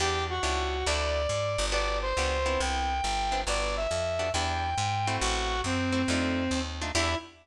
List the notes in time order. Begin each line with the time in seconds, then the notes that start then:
0.00 E2 B3 D4 E4 G4
0.30 F#4
0.43 C#2 B3 D4 E4 G4
0.86 D2 A3 D4 E4 F#4 D5
1.29 G#2
1.58 G1
1.72 B3 D4 F#4 G4 D5
2.02 C5
2.17 C#2 B3 D4 F#4 G4
2.46 B3 C4 D4 E4
2.60 C2 G5
3.04 G1
3.32 B3 C4 D4 E4
3.47 G1 B3 D4 F#4 G4 D5
3.77 E5
3.91 F2
4.19 B3 D4 F#4 G4
4.33 E2 B3 D4 E4 G4 G5
4.78 G#2
5.07 A3 C4 E4 F#4
5.21 A1 F#4
5.64 F#2 C4
5.92 A3 C4 E4 F#4
6.08 F2 A3 D4 D#4 F4
6.51 D#2
6.82 A3 D4 D#4 F4
6.95 E2 B3 D4 E4 G4